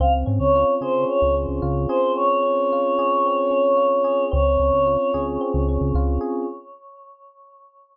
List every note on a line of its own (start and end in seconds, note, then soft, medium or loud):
0.00 0.24 C#2 medium
0.00 1.08 C4 loud
0.00 0.13 F5 medium
0.26 0.39 G#2 loud
0.26 1.34 C#4 medium
0.39 0.65 C#2 medium
0.39 0.74 C#5 medium
0.55 1.61 F4 medium
0.81 1.05 C#3 medium
0.81 1.89 G#4 medium
0.81 1.04 C5 medium
1.08 2.15 C4 medium
1.08 1.35 C#5 medium
1.22 1.46 C#2 medium
1.34 2.42 C#4 medium
1.49 1.61 C#2 medium
1.62 1.87 C#2 medium
1.62 2.72 F4 medium
1.88 2.98 G#4 medium
1.88 2.12 C5 medium
2.16 3.25 C4 medium
2.16 4.25 C#5 medium
2.42 3.50 C#4 medium
2.72 3.76 F4 medium
2.98 4.04 G#4 medium
3.26 4.28 C4 medium
3.51 4.28 C#4 medium
3.77 4.28 F4 medium
4.04 4.30 G#4 medium
4.31 4.57 C#2 loud
4.31 5.40 C4 loud
4.31 5.20 C#5 medium
4.60 4.72 C#2 medium
4.60 5.68 C#4 medium
4.73 4.97 C#2 loud
4.86 5.95 F4 medium
5.14 5.38 C#2 loud
5.14 6.20 G#4 medium
5.41 6.43 C4 medium
5.54 5.78 C#2 medium
5.68 6.45 C#4 medium
5.81 5.93 C#2 medium
5.94 6.19 C#2 medium
5.94 6.47 F4 medium
6.21 6.46 G#4 medium